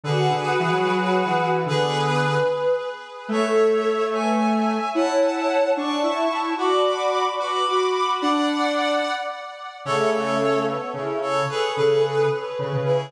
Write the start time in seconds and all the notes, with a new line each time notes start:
0.04 D3 F#4 G#4 B4
0.30 D3
0.60 E3
0.72 F#3
0.86 F#3
1.26 E3
1.66 D3 B3 G#4 B4
2.22 B4
3.28 A3 A4 C#5 E5
4.13 B4 E5 G#5
4.40 E5
4.95 E4 C#5 F#5 A5
5.76 D4 D5 A5 C#6
6.03 E4 E5
6.31 E4
6.58 F#4 D5 B5 D6
7.39 F#4 B4 B5 D6
7.68 F#4
8.21 D4 D5 F#5
9.85 C#3 A3 A4 C#5
10.13 A4 C#5
10.68 B3
10.94 C#3 E4
11.22 A4 C#5
11.49 G#4 A4 B4
11.76 C#3 G#4 B4
12.31 B4
12.59 C#3
12.73 C#3
12.86 E4 G#4